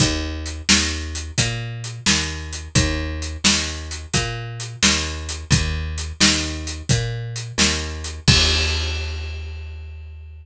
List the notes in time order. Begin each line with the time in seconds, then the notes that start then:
0.00 D#2, kick, closed hi-hat
0.46 closed hi-hat
0.69 D#2, snare
1.15 closed hi-hat
1.38 A#2, kick, closed hi-hat
1.84 closed hi-hat
2.06 D#2, snare
2.53 closed hi-hat
2.75 D#2, kick, closed hi-hat
3.22 closed hi-hat
3.44 D#2, snare
3.91 closed hi-hat
4.14 A#2, kick, closed hi-hat
4.60 closed hi-hat
4.83 D#2, snare
5.29 closed hi-hat
5.51 D#2, kick, closed hi-hat
5.98 closed hi-hat
6.20 D#2, snare
6.67 closed hi-hat
6.89 A#2, kick, closed hi-hat
7.36 closed hi-hat
7.58 D#2, snare
8.04 closed hi-hat
8.28 D#2, kick, crash